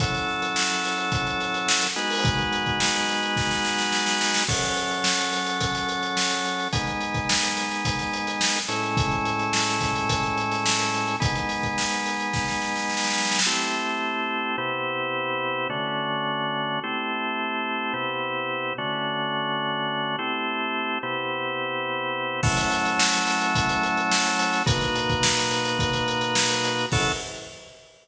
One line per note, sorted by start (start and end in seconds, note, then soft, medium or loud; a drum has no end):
0.00 1.87 F#3 medium
0.00 1.87 C#4 medium
0.00 1.87 E4 medium
0.00 1.87 A4 medium
0.00 kick loud
0.00 closed hi-hat loud
0.14 snare soft
0.14 closed hi-hat medium
0.28 snare soft
0.42 closed hi-hat medium
0.56 snare loud
0.70 snare soft
0.70 closed hi-hat medium
0.84 snare medium
0.84 closed hi-hat medium
0.98 closed hi-hat medium
1.12 kick loud
1.12 closed hi-hat medium
1.27 closed hi-hat medium
1.40 snare soft
1.40 closed hi-hat medium
1.54 closed hi-hat medium
1.68 snare loud
1.82 closed hi-hat medium
1.96 4.44 G#3 medium
1.96 4.44 B3 medium
1.96 4.44 D#4 medium
1.96 4.44 F#4 medium
1.96 closed hi-hat medium
2.10 open hi-hat medium
2.25 kick loud
2.25 closed hi-hat loud
2.39 closed hi-hat medium
2.52 closed hi-hat medium
2.66 kick medium
2.66 closed hi-hat medium
2.80 snare loud
2.94 closed hi-hat medium
3.09 snare medium
3.09 closed hi-hat medium
3.23 closed hi-hat medium
3.36 kick medium
3.36 snare medium
3.51 snare medium
3.65 snare medium
3.79 snare medium
3.92 snare medium
4.06 snare medium
4.21 snare loud
4.34 snare loud
4.48 6.68 F#3 medium
4.48 6.68 C#4 medium
4.48 6.68 A4 medium
4.48 kick medium
4.48 crash loud
4.62 closed hi-hat medium
4.77 closed hi-hat medium
4.91 closed hi-hat medium
5.04 snare loud
5.19 closed hi-hat medium
5.33 snare medium
5.33 closed hi-hat medium
5.46 closed hi-hat medium
5.61 kick medium
5.61 closed hi-hat loud
5.75 snare soft
5.75 closed hi-hat medium
5.89 closed hi-hat medium
6.03 closed hi-hat medium
6.17 snare loud
6.31 closed hi-hat medium
6.45 closed hi-hat medium
6.59 closed hi-hat medium
6.73 8.59 G#3 medium
6.73 8.59 B3 medium
6.73 8.59 D#4 medium
6.73 kick loud
6.73 closed hi-hat loud
6.87 closed hi-hat medium
7.01 closed hi-hat medium
7.14 kick medium
7.14 closed hi-hat medium
7.29 snare loud
7.43 closed hi-hat medium
7.57 snare medium
7.57 closed hi-hat medium
7.71 snare soft
7.71 closed hi-hat medium
7.85 kick medium
7.85 closed hi-hat loud
7.99 snare soft
7.99 closed hi-hat medium
8.13 closed hi-hat medium
8.27 closed hi-hat medium
8.41 snare loud
8.56 closed hi-hat medium
8.68 11.16 A2 medium
8.68 11.16 G#3 medium
8.68 11.16 C#4 medium
8.68 11.16 E4 medium
8.68 closed hi-hat medium
8.83 closed hi-hat medium
8.97 kick loud
8.97 closed hi-hat loud
9.11 closed hi-hat medium
9.25 closed hi-hat medium
9.39 closed hi-hat medium
9.53 snare loud
9.68 closed hi-hat medium
9.81 kick medium
9.81 snare medium
9.81 closed hi-hat medium
9.95 closed hi-hat medium
10.09 kick medium
10.09 closed hi-hat loud
10.23 closed hi-hat medium
10.38 closed hi-hat medium
10.52 snare soft
10.52 closed hi-hat medium
10.66 snare loud
10.79 closed hi-hat medium
10.94 closed hi-hat medium
11.07 closed hi-hat medium
11.20 13.40 G#3 medium
11.20 13.40 B3 loud
11.20 13.40 D#4 medium
11.20 kick loud
11.20 closed hi-hat loud
11.35 closed hi-hat medium
11.49 snare soft
11.49 closed hi-hat medium
11.63 kick medium
11.63 closed hi-hat medium
11.78 snare medium
11.91 closed hi-hat medium
12.05 snare medium
12.05 closed hi-hat medium
12.20 closed hi-hat medium
12.33 kick medium
12.33 snare medium
12.48 snare medium
12.62 snare medium
12.76 snare medium
12.90 snare medium
12.97 snare medium
13.04 snare medium
13.10 snare medium
13.18 snare medium
13.25 snare medium
13.31 snare medium
13.39 snare loud
13.46 14.56 A3 medium
13.46 14.56 C4 medium
13.46 14.56 E4 medium
13.46 14.56 G4 medium
14.58 15.68 C3 medium
14.58 15.68 B3 medium
14.58 15.68 E4 medium
14.58 15.68 G4 medium
15.70 16.80 D3 medium
15.70 16.80 A3 medium
15.70 16.80 C#4 medium
15.70 16.80 F#4 medium
16.84 17.93 A3 medium
16.84 17.93 C4 medium
16.84 17.93 E4 medium
16.84 17.93 G4 medium
17.94 18.73 C3 medium
17.94 18.73 B3 medium
17.94 18.73 E4 medium
17.94 18.73 G4 medium
18.78 20.16 D3 medium
18.78 20.16 A3 medium
18.78 20.16 C#4 medium
18.78 20.16 F#4 medium
20.19 20.98 A3 medium
20.19 20.98 C4 medium
20.19 20.98 E4 medium
20.19 20.98 G4 medium
21.03 22.41 C3 medium
21.03 22.41 B3 medium
21.03 22.41 E4 medium
21.03 22.41 G4 medium
22.43 24.63 F#3 medium
22.43 24.63 A3 loud
22.43 24.63 C#4 medium
22.43 24.63 E4 loud
22.43 kick loud
22.43 crash loud
22.57 snare soft
22.57 closed hi-hat loud
22.71 closed hi-hat medium
22.85 closed hi-hat medium
22.99 snare loud
23.13 snare soft
23.13 closed hi-hat medium
23.27 snare medium
23.27 closed hi-hat medium
23.41 closed hi-hat medium
23.55 kick loud
23.55 closed hi-hat loud
23.69 closed hi-hat medium
23.83 closed hi-hat medium
23.97 closed hi-hat medium
24.11 snare loud
24.25 closed hi-hat medium
24.39 closed hi-hat loud
24.53 snare soft
24.53 closed hi-hat medium
24.66 26.86 B2 medium
24.66 26.86 A#3 medium
24.66 26.86 D#4 medium
24.66 26.86 F#4 medium
24.66 kick loud
24.66 closed hi-hat loud
24.81 snare soft
24.81 closed hi-hat medium
24.95 closed hi-hat medium
25.09 kick loud
25.09 closed hi-hat medium
25.23 snare loud
25.37 closed hi-hat medium
25.51 snare medium
25.51 closed hi-hat medium
25.65 closed hi-hat medium
25.79 kick loud
25.79 closed hi-hat loud
25.93 closed hi-hat medium
26.08 closed hi-hat medium
26.21 closed hi-hat medium
26.35 snare loud
26.50 closed hi-hat medium
26.64 closed hi-hat loud
26.78 closed hi-hat medium
26.92 27.12 F#3 loud
26.92 27.12 C#4 loud
26.92 27.12 E4 loud
26.92 27.12 A4 loud
26.92 kick loud
26.92 crash loud